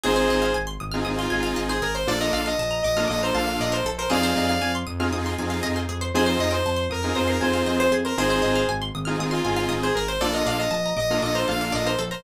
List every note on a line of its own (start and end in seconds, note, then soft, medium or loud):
0.03 0.27 G#1 loud
0.03 0.45 C4 medium
0.03 0.45 D#4 medium
0.03 0.45 F4 medium
0.03 0.15 G#4 loud
0.03 0.45 G#4 medium
0.03 0.53 G#4 medium
0.03 0.53 C5 medium
0.16 0.27 C5 medium
0.30 0.51 G#1 medium
0.30 0.42 D#5 medium
0.42 0.53 F5 medium
0.54 0.76 G#1 medium
0.54 0.66 G#5 medium
0.67 0.78 C6 medium
0.80 1.02 G#1 loud
0.80 0.92 D#6 medium
0.92 1.04 C4 medium
0.92 1.04 D#4 medium
0.92 1.04 F4 medium
0.92 1.04 G#4 medium
0.92 1.03 F6 medium
1.05 1.27 G#1 medium
1.05 1.26 C4 medium
1.05 1.26 D#4 medium
1.05 1.26 F4 medium
1.05 1.26 G#4 medium
1.05 1.16 D#6 medium
1.18 1.59 F4 medium
1.18 1.30 C6 medium
1.30 1.53 G#1 medium
1.30 1.71 C4 medium
1.30 1.71 D#4 medium
1.30 1.71 F4 medium
1.30 1.71 G#4 medium
1.30 1.42 G#5 medium
1.43 1.54 F5 medium
1.56 1.79 G#1 medium
1.56 1.68 D#5 medium
1.69 1.81 G#4 medium
1.69 1.81 C5 medium
1.82 2.04 G#1 medium
1.82 1.94 G#4 medium
1.82 1.94 A#4 medium
1.95 2.06 C5 medium
1.95 2.07 C5 medium
2.07 2.29 A#1 loud
2.07 2.48 A#3 medium
2.07 2.48 D4 medium
2.07 2.48 F4 medium
2.07 2.48 A4 medium
2.07 2.20 A4 medium
2.07 2.20 D5 loud
2.20 2.32 A#4 medium
2.20 2.33 D#5 medium
2.32 2.54 A#1 medium
2.32 2.44 D5 medium
2.32 2.44 F5 medium
2.46 2.82 D#5 medium
2.46 2.57 F5 medium
2.59 2.80 A#1 medium
2.59 2.71 A5 medium
2.71 2.82 A#5 medium
2.82 3.06 A#1 loud
2.82 3.07 D#5 medium
2.82 2.96 D6 medium
2.96 3.07 A#3 medium
2.96 3.07 D4 medium
2.96 3.07 F4 medium
2.96 3.07 A4 medium
2.96 3.08 F6 medium
3.08 3.31 A#1 medium
3.08 3.30 A#3 medium
3.08 3.30 D4 medium
3.08 3.30 F4 medium
3.08 3.30 A4 medium
3.08 3.21 D#5 medium
3.08 3.19 D6 medium
3.23 3.35 C5 medium
3.23 3.35 A#5 medium
3.34 3.56 A#1 loud
3.34 3.75 A#3 medium
3.34 3.75 D4 medium
3.34 3.75 F4 medium
3.34 3.75 A4 medium
3.34 3.59 F5 medium
3.34 3.46 A5 medium
3.47 3.58 F5 medium
3.60 3.81 A#1 loud
3.60 3.72 D5 medium
3.60 3.73 D#5 medium
3.72 3.83 A#4 medium
3.72 3.85 C5 medium
3.84 4.06 A#1 loud
3.84 3.97 A4 medium
3.98 4.10 A#4 medium
3.98 4.10 C5 medium
4.10 4.32 F2 loud
4.10 4.51 C4 medium
4.10 4.51 D#4 medium
4.10 4.51 F4 medium
4.10 4.21 G#4 medium
4.10 4.51 G#4 loud
4.10 4.72 D5 medium
4.10 4.72 F5 loud
4.23 4.35 C5 medium
4.36 4.58 F2 loud
4.36 4.48 D#5 medium
4.49 4.61 F5 medium
4.62 4.83 F2 loud
4.62 4.73 G#5 medium
4.75 4.86 C6 medium
4.87 5.09 F2 medium
4.87 4.98 D#6 medium
4.99 5.09 C4 medium
4.99 5.09 D#4 medium
4.99 5.09 F4 medium
4.99 5.09 G#4 medium
4.99 5.11 F6 medium
5.12 5.33 F2 loud
5.12 5.33 C4 medium
5.12 5.33 D#4 medium
5.12 5.33 F4 medium
5.12 5.33 G#4 medium
5.12 5.24 D#6 medium
5.26 5.37 C6 medium
5.38 5.60 F2 loud
5.38 5.79 C4 medium
5.38 5.79 D#4 medium
5.38 5.79 F4 medium
5.38 5.79 G#4 medium
5.38 5.50 G#5 medium
5.50 5.61 F5 medium
5.63 5.86 F2 loud
5.63 5.74 D#5 loud
5.76 5.87 C5 medium
5.89 6.10 F2 medium
5.89 6.00 G#4 medium
6.01 6.13 C5 medium
6.14 6.36 F2 loud
6.14 6.55 C4 medium
6.14 6.55 D#4 loud
6.14 6.55 F4 medium
6.14 6.55 G#4 medium
6.14 6.27 G#4 loud
6.14 6.26 C5 loud
6.26 6.38 C5 medium
6.26 6.39 C5 medium
6.39 6.61 F2 medium
6.39 6.52 D#5 medium
6.51 6.84 C5 medium
6.51 6.62 G5 medium
6.65 6.87 F2 medium
6.65 6.77 A5 medium
6.76 6.88 C6 medium
6.90 7.11 F2 loud
6.90 7.16 A#4 medium
6.90 7.02 D#6 medium
7.03 7.14 C4 medium
7.03 7.14 D#4 medium
7.03 7.14 F4 medium
7.03 7.14 G#4 medium
7.03 7.15 F6 medium
7.15 7.38 F2 medium
7.15 7.36 C4 medium
7.15 7.36 D#4 medium
7.15 7.36 F4 medium
7.15 7.36 G#4 medium
7.15 7.28 C5 medium
7.15 7.27 D#6 medium
7.28 7.41 A#4 medium
7.28 7.39 C6 medium
7.41 7.63 F2 medium
7.41 7.82 C4 medium
7.41 7.82 D#4 medium
7.41 7.82 F4 medium
7.41 7.82 G#4 medium
7.41 7.66 C5 medium
7.41 7.53 G#5 medium
7.53 7.65 F5 medium
7.66 7.88 F2 loud
7.66 7.79 C5 medium
7.66 7.78 D#5 medium
7.79 7.91 C5 medium
7.79 7.91 C5 loud
7.91 8.13 F2 medium
7.91 8.03 G#4 medium
8.05 8.17 A#4 medium
8.05 8.16 C5 medium
8.17 8.39 G#1 loud
8.17 8.58 C4 medium
8.17 8.58 D#4 medium
8.17 8.58 F4 medium
8.17 8.58 G#4 medium
8.17 8.65 G#4 medium
8.17 8.30 G#4 loud
8.17 8.65 C5 medium
8.30 8.42 C5 medium
8.42 8.64 G#1 medium
8.42 8.53 D#5 medium
8.56 8.67 F5 medium
8.68 8.90 G#1 medium
8.68 8.80 G#5 medium
8.82 8.93 C6 medium
8.95 9.16 G#1 loud
8.95 9.06 D#6 medium
9.05 9.17 C4 medium
9.05 9.17 D#4 medium
9.05 9.17 F4 medium
9.05 9.17 G#4 medium
9.05 9.17 F6 medium
9.18 9.40 G#1 medium
9.18 9.39 C4 medium
9.18 9.39 D#4 medium
9.18 9.39 F4 medium
9.18 9.39 G#4 medium
9.18 9.32 D#6 medium
9.31 9.73 F4 medium
9.31 9.43 C6 medium
9.44 9.66 G#1 medium
9.44 9.85 C4 medium
9.44 9.85 D#4 medium
9.44 9.85 F4 medium
9.44 9.85 G#4 medium
9.44 9.56 G#5 medium
9.56 9.68 F5 medium
9.69 9.91 G#1 medium
9.69 9.80 D#5 medium
9.83 9.95 G#4 medium
9.83 9.95 C5 medium
9.95 10.17 G#1 medium
9.95 10.08 G#4 medium
9.95 10.07 A#4 medium
10.08 10.20 C5 medium
10.20 10.43 A#1 loud
10.20 10.62 A#3 medium
10.20 10.62 D4 medium
10.20 10.62 F4 medium
10.20 10.32 A4 medium
10.20 10.62 A4 medium
10.20 10.33 D5 loud
10.34 10.45 A#4 medium
10.34 10.46 D#5 medium
10.46 10.67 A#1 medium
10.46 10.58 D5 medium
10.46 10.59 F5 medium
10.58 10.94 D#5 medium
10.58 10.71 F5 medium
10.71 10.93 A#1 medium
10.71 10.82 A5 medium
10.86 10.97 A#5 medium
10.97 11.18 A#1 loud
10.97 11.21 D#5 medium
10.97 11.08 D6 medium
11.10 11.20 A#3 medium
11.10 11.20 D4 medium
11.10 11.20 F4 medium
11.10 11.20 A4 medium
11.10 11.23 F6 medium
11.22 11.44 A#1 medium
11.22 11.43 A#3 medium
11.22 11.43 D4 medium
11.22 11.43 F4 medium
11.22 11.43 A4 medium
11.22 11.35 D#5 medium
11.22 11.34 D6 medium
11.35 11.47 C5 medium
11.35 11.47 A#5 medium
11.48 11.70 A#1 loud
11.48 11.89 A#3 medium
11.48 11.89 D4 medium
11.48 11.89 F4 medium
11.48 11.89 A4 medium
11.48 11.72 F5 medium
11.48 11.59 A5 medium
11.61 11.73 F5 medium
11.72 11.95 A#1 loud
11.72 11.84 D5 medium
11.72 11.87 D#5 medium
11.86 11.98 A#4 medium
11.86 11.98 C5 medium
11.99 12.21 A#1 loud
11.99 12.10 A4 medium
12.11 12.22 A#4 medium
12.11 12.23 C5 medium